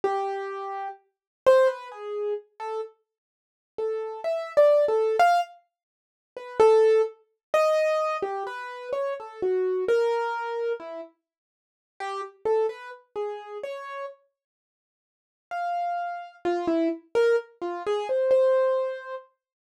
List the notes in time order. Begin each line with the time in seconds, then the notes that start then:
0.04 G4
1.46 C5
1.67 B4
1.92 G#4
2.60 A4
3.78 A4
4.24 E5
4.57 D5
4.88 A4
5.20 F5
6.37 B4
6.60 A4
7.54 D#5
8.22 G4
8.47 B4
8.93 C#5
9.20 A4
9.42 F#4
9.88 A#4
10.80 E4
12.00 G4
12.46 A4
12.69 B4
13.16 G#4
13.63 C#5
15.51 F5
16.45 F4
16.68 E4
17.15 A#4
17.62 F4
17.87 G#4
18.09 C5
18.31 C5